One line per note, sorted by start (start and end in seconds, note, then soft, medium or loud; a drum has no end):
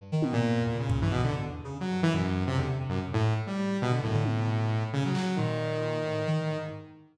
0.01 0.11 G2 medium
0.12 0.32 D#3 loud
0.22 0.33 B2 soft
0.22 high tom loud
0.32 0.42 A#2 loud
0.32 0.63 A#2 loud
0.46 0.59 G#2 medium
0.59 0.72 E2 medium
0.67 0.77 A#2 medium
0.73 0.87 C#3 medium
0.80 1.00 C#3 medium
0.90 1.00 A#2 medium
0.90 kick loud
1.00 1.10 G2 loud
1.00 1.12 E3 medium
1.11 1.21 B2 loud
1.11 1.22 C3 medium
1.11 kick medium
1.24 1.35 G#2 medium
1.24 1.34 D3 medium
1.36 1.49 D3 medium
1.48 1.62 E2 medium
1.64 1.78 C#3 medium
1.81 2.01 F#3 medium
1.91 2.01 G2 medium
2.01 2.12 F#2 medium
2.01 2.13 E3 loud
2.12 2.44 F#2 medium
2.12 2.22 B2 medium
2.47 2.57 C3 loud
2.57 2.67 E2 loud
2.57 2.67 D3 medium
2.69 2.79 C3 medium
2.79 3.00 C3 medium
2.89 2.99 F#2 medium
3.13 3.33 A2 loud
3.47 3.77 G3 medium
3.82 3.92 B2 loud
3.82 3.92 C3 medium
3.91 4.01 D3 medium
4.02 4.12 F#2 loud
4.02 4.83 A2 medium
4.02 kick medium
4.13 4.23 D3 loud
4.25 high tom loud
4.37 4.47 C3 medium
4.47 4.60 B2 medium
4.47 floor tom medium
4.63 4.76 B2 medium
4.77 4.91 A2 soft
4.93 5.04 B2 medium
4.93 5.03 C#3 loud
5.05 5.15 F#3 medium
5.15 5.36 F#3 medium
5.15 clap medium
5.36 5.98 A#2 medium
5.36 6.57 D#3 medium
6.04 6.24 A2 medium
6.27 6.40 D#3 loud
6.41 6.55 A2 medium
6.56 6.69 G#2 medium